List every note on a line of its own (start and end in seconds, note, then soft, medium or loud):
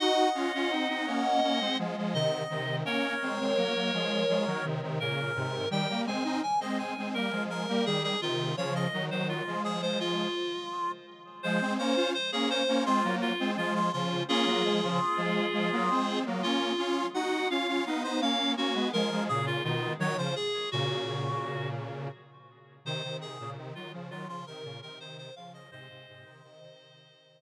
0.00 0.29 D#4 medium
0.00 0.29 F#4 medium
0.00 1.77 D#5 medium
0.00 1.77 F#5 medium
0.35 0.52 C#4 medium
0.35 0.52 F4 medium
0.54 0.71 C#4 medium
0.54 0.71 F4 medium
0.71 0.88 C4 medium
0.71 0.88 D#4 medium
0.89 1.06 C4 medium
0.89 1.06 D#4 medium
1.06 1.40 A#3 medium
1.06 1.40 C#4 medium
1.43 1.60 A#3 medium
1.43 1.60 C#4 medium
1.60 1.77 G#3 medium
1.60 1.77 C4 medium
1.79 1.96 F3 medium
1.79 1.96 G#3 medium
1.97 2.14 F3 medium
1.97 2.14 G#3 medium
2.14 2.43 C3 medium
2.14 2.43 D#3 medium
2.14 2.76 D#5 medium
2.50 2.83 C3 medium
2.50 2.83 D#3 medium
2.85 3.15 A#3 medium
2.85 3.15 C#4 medium
2.85 4.65 A#4 medium
2.85 4.65 C#5 medium
3.22 3.39 G#3 medium
3.22 3.39 C4 medium
3.40 3.57 G#3 medium
3.40 3.57 C4 medium
3.57 3.74 F#3 medium
3.57 3.74 A#3 medium
3.74 3.91 F#3 medium
3.74 3.91 A#3 medium
3.94 4.24 F3 medium
3.94 4.24 G#3 medium
4.28 4.45 F3 medium
4.28 4.45 G#3 medium
4.46 4.63 D#3 medium
4.46 4.63 F#3 medium
4.64 4.81 C3 medium
4.64 4.81 D#3 medium
4.82 4.99 C3 medium
4.82 4.99 D#3 medium
5.00 5.32 A#2 medium
5.00 5.32 C#3 medium
5.00 5.69 A#4 medium
5.35 5.66 G#2 medium
5.35 5.66 C3 medium
5.70 5.87 D#3 medium
5.70 5.87 G3 medium
5.70 6.01 G5 medium
5.89 6.06 G3 medium
5.89 6.06 A#3 medium
6.06 6.23 G#3 medium
6.06 6.23 C4 medium
6.06 6.39 G#5 medium
6.24 6.41 C4 medium
6.24 6.41 D#4 medium
6.43 6.60 G#5 medium
6.60 6.94 G#3 medium
6.60 6.94 C4 medium
6.60 6.78 D#5 medium
6.79 7.09 G#5 medium
6.97 7.14 G#3 medium
6.97 7.14 C4 medium
7.14 7.32 G3 medium
7.14 7.32 A#3 medium
7.14 7.43 A#4 medium
7.31 7.66 F3 medium
7.31 7.66 G#3 medium
7.50 7.85 A#4 medium
7.68 7.85 G3 medium
7.68 7.85 A#3 medium
7.86 8.15 D#3 medium
7.86 8.15 G3 medium
7.86 8.03 G#4 medium
8.04 8.21 G#4 medium
8.22 8.54 C3 medium
8.22 8.54 D#3 medium
8.22 8.56 F4 medium
8.57 8.87 C#3 medium
8.57 8.87 F3 medium
8.57 8.74 C#5 medium
8.75 9.05 D#5 medium
8.93 9.10 D#3 medium
8.93 9.10 F#3 medium
9.11 9.42 D#3 medium
9.11 9.42 F#3 medium
9.11 9.28 C5 medium
9.29 9.62 F4 medium
9.47 10.28 F3 medium
9.47 10.28 G#3 medium
9.64 9.81 G#4 medium
9.82 9.99 C5 medium
10.00 10.92 F4 medium
11.43 11.60 F3 medium
11.43 11.60 G#3 medium
11.43 11.73 C5 medium
11.61 11.78 G#3 medium
11.61 11.78 C4 medium
11.78 11.95 A#3 medium
11.78 11.95 C#4 medium
11.78 12.10 C5 medium
11.96 12.13 C#4 medium
11.96 12.13 F4 medium
12.14 12.31 C5 medium
12.32 12.62 A#3 medium
12.32 12.62 C#4 medium
12.32 12.49 G#4 medium
12.50 12.84 C5 medium
12.68 12.85 A#3 medium
12.68 12.85 C#4 medium
12.86 13.03 G#3 medium
12.86 13.03 C4 medium
12.86 13.15 F4 medium
13.04 13.32 F#3 medium
13.04 13.32 A#3 medium
13.21 13.51 F4 medium
13.40 13.56 G#3 medium
13.40 13.57 C4 medium
13.57 13.90 F3 medium
13.57 13.90 G#3 medium
13.57 13.74 F4 medium
13.75 13.92 F4 medium
13.93 14.23 C#3 medium
13.93 14.23 F3 medium
13.93 14.23 F4 medium
14.28 14.45 A#3 medium
14.28 14.45 C#4 medium
14.28 16.19 F4 medium
14.28 16.19 G#4 medium
14.46 14.63 F#3 medium
14.46 14.63 A#3 medium
14.64 14.81 F3 medium
14.64 14.81 G#3 medium
14.83 15.00 C#3 medium
14.83 15.00 F3 medium
15.17 15.46 F3 medium
15.17 15.46 G#3 medium
15.53 15.70 F3 medium
15.53 15.70 G#3 medium
15.72 15.89 F#3 medium
15.72 15.89 A#3 medium
15.90 16.24 G#3 medium
15.90 16.24 C4 medium
16.26 16.43 F#3 medium
16.26 16.42 A#3 medium
16.42 16.72 A#3 medium
16.42 16.72 C#4 medium
16.42 17.06 F4 medium
16.78 17.06 C#4 medium
16.78 17.06 F4 medium
17.14 17.47 D#4 medium
17.14 17.47 F#4 medium
17.14 17.49 F#5 loud
17.50 17.67 C#4 medium
17.50 17.67 F4 medium
17.50 17.83 F5 medium
17.68 17.85 C#4 medium
17.68 17.85 F4 medium
17.86 18.03 B3 medium
17.86 18.03 D#4 medium
17.86 18.03 F5 medium
18.04 18.21 B3 medium
18.04 18.21 D#4 medium
18.04 18.21 C5 medium
18.21 18.55 A#3 medium
18.21 18.55 C#4 medium
18.21 18.52 F5 medium
18.57 18.74 A#3 medium
18.57 18.74 C#4 medium
18.57 18.88 F#4 medium
18.74 18.91 G#3 medium
18.74 18.91 B3 medium
18.93 19.10 F3 medium
18.93 19.10 G#3 medium
18.93 19.24 A#4 medium
19.11 19.28 F3 medium
19.11 19.28 G#3 medium
19.29 19.62 A#2 medium
19.29 19.62 C#3 medium
19.29 19.46 G#4 medium
19.46 19.63 F4 medium
19.64 19.94 B2 medium
19.64 19.94 D#3 medium
19.64 19.93 F4 medium
19.99 20.16 D#3 medium
19.99 20.16 F#3 medium
19.99 20.17 C#5 medium
20.17 20.34 C#3 medium
20.17 20.34 F3 medium
20.17 20.35 C5 medium
20.36 20.69 G#4 medium
20.71 22.08 A#2 medium
20.71 22.08 C#3 medium
20.71 21.69 F#4 medium
22.85 23.02 C3 medium
22.85 23.02 D#3 medium
22.85 23.17 C5 medium
23.04 23.38 C3 medium
23.04 23.38 D#3 medium
23.21 23.50 G#4 medium
23.40 23.57 A#2 medium
23.40 23.57 C#3 medium
23.57 23.74 C3 medium
23.57 23.74 D#3 medium
23.75 23.92 D#3 medium
23.75 23.92 F#3 medium
23.75 23.92 F4 medium
23.93 24.10 C#3 medium
23.93 24.10 F3 medium
24.10 24.27 D#3 medium
24.10 24.27 F#3 medium
24.10 24.28 F4 medium
24.28 24.44 C#3 medium
24.28 24.44 F3 medium
24.28 24.46 F4 medium
24.46 24.64 C3 medium
24.46 24.64 D#3 medium
24.46 24.80 A#4 medium
24.64 24.81 A#2 medium
24.64 24.81 C#3 medium
24.82 24.98 C3 medium
24.82 24.98 D#3 medium
24.82 24.99 A#4 medium
24.99 25.30 C3 medium
24.99 25.30 D#3 medium
24.99 25.17 C5 medium
25.18 25.35 C5 medium
25.36 25.69 C#3 medium
25.36 25.69 F3 medium
25.36 25.53 F5 medium
25.54 25.71 D#5 medium
25.71 25.88 G#2 medium
25.71 25.88 C3 medium
25.71 27.41 C5 medium
25.71 27.41 D#5 loud
25.89 26.06 G#2 medium
25.89 26.06 C3 medium
26.08 26.25 G#2 medium
26.08 26.24 C3 medium
26.25 26.42 C3 medium
26.25 26.42 D#3 medium
26.43 26.60 C3 medium
26.43 26.60 D#3 medium
26.61 27.41 C3 medium
26.61 27.41 D#3 medium